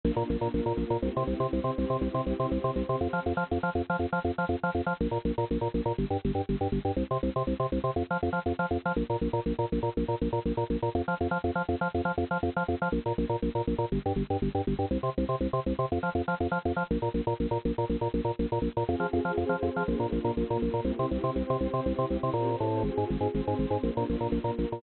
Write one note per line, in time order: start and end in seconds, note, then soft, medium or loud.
0.04 0.11 A#1 loud
0.04 0.53 A#3 medium
0.04 0.53 D4 medium
0.04 0.53 F4 medium
0.16 0.23 A#2 loud
0.30 0.37 A#1 loud
0.41 0.48 A#2 medium
0.53 0.61 A#1 medium
0.53 1.02 A#3 medium
0.53 1.02 F4 medium
0.53 1.02 A#4 medium
0.66 0.73 A#2 medium
0.77 0.84 A#1 medium
0.90 0.97 A#2 medium
1.02 1.09 C2 loud
1.02 1.51 C4 medium
1.02 1.52 E4 medium
1.02 1.51 G4 medium
1.17 1.23 C3 loud
1.27 1.34 C2 medium
1.40 1.47 C3 medium
1.52 1.60 C2 medium
1.52 2.01 C4 medium
1.52 2.01 G4 medium
1.52 2.01 C5 medium
1.64 1.71 C3 medium
1.78 1.85 C2 medium
1.90 1.97 C3 medium
2.01 2.08 C2 loud
2.01 2.51 C4 medium
2.01 2.51 E4 medium
2.01 2.51 G4 medium
2.14 2.21 C3 loud
2.26 2.33 C2 medium
2.40 2.46 C3 medium
2.51 2.58 C2 medium
2.51 3.01 C4 medium
2.51 3.01 G4 medium
2.51 3.01 C5 medium
2.64 2.71 C3 loud
2.76 2.83 C2 medium
2.89 2.96 C3 medium
3.01 3.08 F2 loud
3.13 3.20 F3 medium
3.26 3.33 F2 medium
3.37 3.44 F3 medium
3.51 3.58 F2 medium
3.63 3.70 F3 medium
3.75 3.82 F2 medium
3.90 3.96 F3 medium
3.99 4.06 F2 medium
4.13 4.19 F3 medium
4.24 4.31 F2 medium
4.38 4.45 F3 medium
4.49 4.56 F2 medium
4.63 4.70 F3 medium
4.75 4.81 F2 medium
4.86 4.93 F3 medium
5.01 5.07 A#1 loud
5.11 5.18 A#2 medium
5.25 5.32 A#1 medium
5.38 5.45 A#2 medium
5.51 5.58 A#1 medium
5.61 5.68 A#2 medium
5.74 5.81 A#1 medium
5.86 5.92 A#2 loud
5.98 6.05 G1 loud
6.10 6.17 G2 medium
6.25 6.31 G1 medium
6.35 6.42 G2 medium
6.49 6.56 G1 medium
6.61 6.68 G2 medium
6.72 6.79 G1 medium
6.85 6.92 G2 medium
6.96 7.03 C2 loud
7.11 7.18 C3 medium
7.23 7.30 C2 medium
7.36 7.43 C3 medium
7.47 7.54 C2 medium
7.60 7.66 C3 medium
7.72 7.79 C2 medium
7.84 7.90 C3 medium
7.96 8.03 F2 medium
8.10 8.17 F3 medium
8.23 8.29 F2 medium
8.33 8.39 F3 medium
8.46 8.53 F2 medium
8.59 8.66 F3 medium
8.71 8.78 F2 medium
8.85 8.92 F3 medium
8.96 9.03 A#1 loud
9.10 9.16 A#2 medium
9.21 9.28 A#1 medium
9.33 9.40 A#2 medium
9.46 9.53 A#1 medium
9.59 9.65 A#2 medium
9.72 9.79 A#1 medium
9.83 9.89 A#2 medium
9.97 10.04 A#1 medium
10.08 10.15 A#2 medium
10.21 10.28 A#1 medium
10.33 10.39 A#2 medium
10.45 10.52 A#1 medium
10.57 10.64 A#2 medium
10.70 10.77 A#1 medium
10.82 10.89 A#2 medium
10.95 11.02 F2 loud
11.08 11.15 F3 loud
11.21 11.27 F2 medium
11.31 11.38 F3 loud
11.44 11.51 F2 loud
11.55 11.62 F3 loud
11.69 11.75 F2 loud
11.81 11.88 F3 loud
11.94 12.01 F2 medium
12.05 12.12 F3 loud
12.18 12.24 F2 loud
12.31 12.38 F3 medium
12.43 12.50 F2 loud
12.56 12.63 F3 loud
12.68 12.75 F2 loud
12.82 12.88 F3 loud
12.92 12.99 A#1 loud
13.06 13.13 A#2 medium
13.18 13.25 A#1 loud
13.29 13.36 A#2 loud
13.42 13.49 A#1 loud
13.55 13.62 A#2 medium
13.67 13.74 A#1 loud
13.78 13.85 A#2 loud
13.92 13.99 G1 loud
14.06 14.12 G2 loud
14.16 14.23 G1 loud
14.30 14.37 G2 medium
14.42 14.49 G1 loud
14.55 14.61 G2 medium
14.67 14.74 G1 loud
14.79 14.85 G2 loud
14.91 14.98 C2 loud
15.03 15.10 C3 loud
15.18 15.24 C2 loud
15.29 15.36 C3 loud
15.40 15.47 C2 medium
15.53 15.60 C3 loud
15.66 15.73 C2 loud
15.79 15.86 C3 loud
15.92 15.99 F2 loud
16.03 16.10 F3 medium
16.15 16.22 F2 loud
16.28 16.35 F3 medium
16.40 16.47 F2 medium
16.51 16.58 F3 loud
16.65 16.72 F2 loud
16.76 16.83 F3 medium
16.91 16.98 A#1 loud
17.02 17.09 A#2 loud
17.14 17.21 A#1 medium
17.27 17.34 A#2 loud
17.40 17.47 A#1 medium
17.51 17.58 A#2 loud
17.65 17.72 A#1 loud
17.78 17.85 A#2 loud
17.89 17.96 A#1 loud
18.01 18.08 A#2 medium
18.14 18.21 A#1 loud
18.25 18.31 A#2 loud
18.39 18.46 A#1 loud
18.52 18.59 A#2 loud
18.62 18.68 A#1 loud
18.77 18.84 A#2 loud
18.87 18.95 F2 loud
18.87 19.36 C4 medium
18.87 19.36 F4 medium
18.87 19.36 G#4 medium
19.00 19.07 F3 loud
19.13 19.20 F2 loud
19.25 19.32 F3 loud
19.37 19.44 F2 loud
19.37 19.87 C4 medium
19.37 19.87 G#4 medium
19.37 19.87 C5 medium
19.49 19.56 F3 loud
19.63 19.69 F2 loud
19.76 19.83 F3 loud
19.87 19.95 A#1 loud
19.87 20.36 A#3 medium
19.87 20.36 D4 medium
19.87 20.36 F4 medium
20.00 20.06 A#2 loud
20.12 20.19 A#1 loud
20.24 20.31 A#2 loud
20.37 20.44 A#1 loud
20.37 20.86 A#3 medium
20.37 20.86 F4 medium
20.37 20.86 A#4 medium
20.50 20.57 A#2 loud
20.62 20.69 A#1 loud
20.74 20.80 A#2 loud
20.85 20.91 C2 loud
20.85 21.36 C4 medium
20.85 21.36 E4 medium
20.85 21.36 G4 medium
20.99 21.06 C3 loud
21.11 21.18 C2 loud
21.24 21.30 C3 loud
21.36 21.43 C2 loud
21.36 21.85 C4 medium
21.36 21.85 G4 medium
21.36 21.85 C5 medium
21.50 21.57 C3 loud
21.61 21.67 C2 loud
21.74 21.80 C3 loud
21.85 21.93 C2 loud
21.85 22.34 C4 medium
21.85 22.34 E4 medium
21.85 22.34 G4 medium
21.98 22.05 C3 loud
22.10 22.17 C2 loud
22.23 22.30 C3 loud
22.33 22.56 A#2 loud
22.33 22.84 C4 medium
22.33 22.84 G4 medium
22.33 22.84 C5 medium
22.60 22.83 A2 loud
22.83 22.90 G#1 loud
22.83 23.34 C4 medium
22.83 23.34 F4 medium
22.83 23.34 G#4 medium
22.97 23.04 G#2 loud
23.10 23.17 G#1 loud
23.21 23.27 G#2 loud
23.34 23.41 G#1 loud
23.34 23.83 C4 medium
23.34 23.83 G#4 medium
23.34 23.83 C5 medium
23.47 23.54 G#2 loud
23.59 23.66 G#1 loud
23.70 23.77 G#2 loud
23.83 23.90 A#1 loud
23.83 24.33 A#3 medium
23.83 24.33 D4 medium
23.83 24.33 F4 medium
23.97 24.04 A#2 loud
24.09 24.16 A#1 loud
24.20 24.27 A#2 loud
24.32 24.39 A#1 loud
24.32 24.82 A#3 medium
24.32 24.82 F4 medium
24.32 24.82 A#4 medium
24.44 24.51 A#2 loud
24.58 24.65 A#1 loud
24.72 24.79 A#2 loud